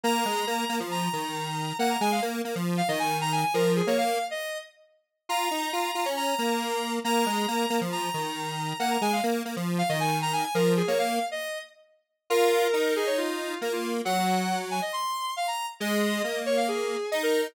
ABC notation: X:1
M:4/4
L:1/16
Q:1/4=137
K:Bbm
V:1 name="Lead 1 (square)"
b8 b8 | g b a f z5 f e a2 b a a | B2 A d f3 e3 z6 | b8 b8 |
b8 b8 | g b a f z5 f e a2 b a a | B2 A d f3 e3 z6 | B6 A d F4 B F2 z |
g6 a e c'4 f b2 z | e6 d f A4 e B2 z |]
V:2 name="Lead 1 (square)"
B,2 A,2 B,2 B, F,3 E,6 | B,2 A,2 B,2 B, F,3 E,6 | F,3 B,3 z10 | F2 E2 F2 F D3 B,6 |
B,2 A,2 B,2 B, F,3 E,6 | B,2 A,2 B,2 B, F,3 E,6 | F,3 B,3 z10 | F4 E8 B,4 |
G,8 z8 | A,4 B,8 E4 |]